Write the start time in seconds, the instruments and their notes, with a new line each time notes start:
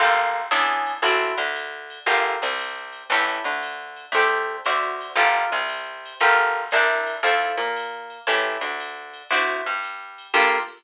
0.00 electric bass (finger) G1, acoustic guitar (steel) A#3 F4 G4 A4, ride
0.51 electric bass (finger) E2, acoustic guitar (steel) C#4 D4 E4 G#4, hi-hat pedal, ride
0.87 ride
1.02 electric bass (finger) A1, acoustic guitar (steel) C4 E4 F#4 A4, ride
1.37 electric bass (finger) D2, acoustic guitar (steel) D3
1.56 hi-hat pedal, ride
1.90 ride
2.06 electric bass (finger) G1, acoustic guitar (steel) F4 G4 A4 A#4, ride
2.42 electric bass (finger) C2, acoustic guitar (steel) C3
2.59 hi-hat pedal, ride
2.93 ride
3.09 electric bass (finger) A1, acoustic guitar (steel) E4 G4 A4 C#5, kick, ride
3.44 electric bass (finger) D2, acoustic guitar (steel) D3
3.63 hi-hat pedal, ride
3.96 ride
4.12 electric bass (finger) D2, acoustic guitar (steel) G4 A4 C5 D5, ride
4.65 electric bass (finger) D2, acoustic guitar (steel) F#4 C5 D5 E5, hi-hat pedal, ride
5.01 ride
5.16 electric bass (finger) G1, acoustic guitar (steel) F4 G4 A4 A#4, ride
5.52 electric bass (finger) C2, acoustic guitar (steel) C3
5.69 hi-hat pedal, ride
6.05 ride
6.20 electric bass (finger) G1, acoustic guitar (steel) F4 G4 A4 A#4, ride
6.71 electric bass (finger) C2, acoustic guitar (steel) D4 E4 A#4 C5, hi-hat pedal, ride
7.06 ride
7.23 electric bass (finger) F2, acoustic guitar (steel) E4 F4 A4 C5, ride
7.57 electric bass (finger) A#2, acoustic guitar (steel) A#3
7.76 hi-hat pedal, ride
8.10 ride
8.27 electric bass (finger) A1, acoustic guitar (steel) E4 G4 A4 C#5, ride
8.61 electric bass (finger) D2, acoustic guitar (steel) D3
8.80 hi-hat pedal, ride
9.13 ride
9.30 electric bass (finger) D2, acoustic guitar (steel) E4 F#4 C5 D5, ride
9.66 electric bass (finger) G2, acoustic guitar (steel) G3
9.83 hi-hat pedal, ride
10.18 ride
10.34 electric bass (finger) G2, acoustic guitar (steel) A#3 F4 G4 A4, kick, crash